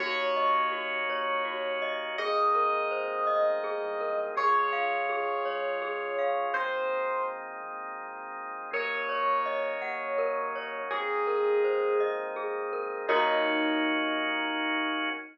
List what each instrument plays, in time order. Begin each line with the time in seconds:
0.00 synth bass 2 D#2, drawbar organ A#3 C#4 D#4 F#4, glockenspiel F#4, electric piano 1 C#5
0.37 glockenspiel D#5
0.72 glockenspiel F#4
1.08 synth bass 2 D#2, glockenspiel C#5
1.45 glockenspiel F#4
1.82 glockenspiel D#5
2.18 synth bass 2 G#1, drawbar organ G#3 A#3 C4 D#4, glockenspiel G#4, electric piano 1 D#5
2.55 glockenspiel A#4
2.91 glockenspiel C5
3.27 synth bass 2 B1, glockenspiel D#5
3.64 glockenspiel G#4
3.81 synth bass 2 C2
4.01 glockenspiel A#4
4.36 synth bass 2 C#2, drawbar organ G#3 C#4 F4, glockenspiel G#4, electric piano 1 C#5
4.73 glockenspiel F5
5.09 glockenspiel G#4
5.45 synth bass 2 C#2, glockenspiel C#5
5.82 glockenspiel G#4
6.18 glockenspiel F5
6.54 synth bass 2 G#1, drawbar organ G#3 A#3 C4 D#4, electric piano 1 C5
7.63 synth bass 2 G#1
8.72 synth bass 2 D#2, drawbar organ F#3 A#3 C#4 D#4, glockenspiel A#4, electric piano 1 C#5
9.09 glockenspiel C#5
9.46 glockenspiel D#5
9.81 synth bass 2 D#2, glockenspiel F#5
10.18 glockenspiel A#4
10.55 glockenspiel C#5
10.91 synth bass 2 G#1, drawbar organ G#3 A#3 C4 D#4, electric piano 1 G#4, glockenspiel G#4
11.27 glockenspiel A#4
11.64 glockenspiel C5
11.99 synth bass 2 G#1, glockenspiel D#5
12.36 glockenspiel G#4
12.73 glockenspiel A#4
13.08 synth bass 2 D#2, drawbar organ A#3 C#4 D#4 F#4, electric piano 1 D#4, glockenspiel F#4 A#4 C#5 D#5